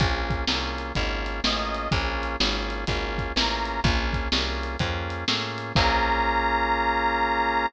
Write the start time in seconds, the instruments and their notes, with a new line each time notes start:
0.00 electric bass (finger) A#1, drawbar organ A#3 C#4 F4 G#4, kick, closed hi-hat
0.30 kick, closed hi-hat
0.47 electric bass (finger) C2, drawbar organ A#3 C#4 F4 G#4, snare
0.78 closed hi-hat
0.95 electric bass (finger) G#1, drawbar organ A#3 C#4 F4 G#4, kick, closed hi-hat
1.26 closed hi-hat
1.44 electric bass (finger) A1, drawbar organ A#3 C#4 F4 G#4, harmonica D#5, snare
1.75 closed hi-hat
1.91 electric bass (finger) A#1, drawbar organ A#3 C#4 F4 G#4, kick, closed hi-hat
2.23 closed hi-hat
2.40 electric bass (finger) G#1, drawbar organ A#3 C#4 F4 G#4, snare
2.70 closed hi-hat
2.87 electric bass (finger) G#1, drawbar organ A#3 C#4 F4 G#4, kick, closed hi-hat
3.18 kick, closed hi-hat
3.36 electric bass (finger) A1, drawbar organ A#3 C#4 F4 G#4, harmonica A#5, snare
3.66 closed hi-hat
3.84 electric bass (finger) A#1, drawbar organ A#3 C#4 F4 G#4, kick, closed hi-hat
4.13 kick, closed hi-hat
4.32 electric bass (finger) C2, drawbar organ A#3 C#4 F4 G#4, snare
4.63 closed hi-hat
4.79 electric bass (finger) F2, drawbar organ A#3 C#4 F4 G#4, kick, closed hi-hat
5.10 closed hi-hat
5.28 electric bass (finger) A2, drawbar organ A#3 C#4 F4 G#4, snare
5.58 closed hi-hat
5.75 electric bass (finger) A#1, drawbar organ A#3 C#4 F4 G#4, harmonica A#5, kick, crash